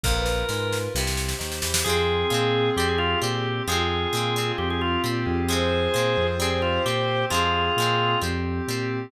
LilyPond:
<<
  \new Staff \with { instrumentName = "Drawbar Organ" } { \time 4/4 \key f \minor \tempo 4 = 132 bes'2 r2 | aes'2 g'16 aes'16 f'8 g'4 | aes'2 g'16 aes'16 f'8 r4 | aes'2 aes'16 aes'16 f'8 g'4 |
f'2 r2 | }
  \new Staff \with { instrumentName = "Violin" } { \time 4/4 \key f \minor bes'16 b'2~ b'16 r4. | aes'1 | f'1 | c''1 |
aes'2 r2 | }
  \new Staff \with { instrumentName = "Acoustic Guitar (steel)" } { \time 4/4 \key f \minor <f, bes,>4 aes4 <g, c>4 ees8 e8 | <f aes c'>4 <f aes c'>4 <g c'>4 <g c'>4 | <f aes c'>4 <f aes c'>8 <g c'>4. <g c'>4 | <f aes c'>4 <f aes c'>4 <g c'>4 <g c'>4 |
<f aes c'>4 <f aes c'>4 <g c'>4 <g c'>4 | }
  \new Staff \with { instrumentName = "Drawbar Organ" } { \time 4/4 \key f \minor r1 | <c' f' aes'>2 <c' g'>2 | <c' f' aes'>2 <c' g'>4. <c' f' aes'>8~ | <c' f' aes'>2 <c' g'>2 |
<c' f' aes'>2 <c' g'>2 | }
  \new Staff \with { instrumentName = "Synth Bass 1" } { \clef bass \time 4/4 \key f \minor bes,,4 aes,4 c,4 ees,8 e,8 | f,4 bes,4 f,4 bes,4 | f,4 bes,4 f,4 bes,8 f,8~ | f,4 bes,8 f,4. bes,4 |
f,4 bes,4 f,4 bes,4 | }
  \new Staff \with { instrumentName = "Pad 5 (bowed)" } { \time 4/4 \key f \minor <f' bes'>2 <g' c''>2 | <c' f' aes'>2 <c' g'>2 | <c' f' aes'>2 <c' g'>2 | <c' f' aes'>2 <c' g'>2 |
<c' f' aes'>2 <c' g'>2 | }
  \new DrumStaff \with { instrumentName = "Drums" } \drummode { \time 4/4 <bd sn>8 sn8 sn8 sn8 sn16 sn16 sn16 sn16 sn16 sn16 sn16 sn16 | r4 r4 r4 r4 | r4 r4 r4 r4 | r4 r4 r4 r4 |
r4 r4 r4 r4 | }
>>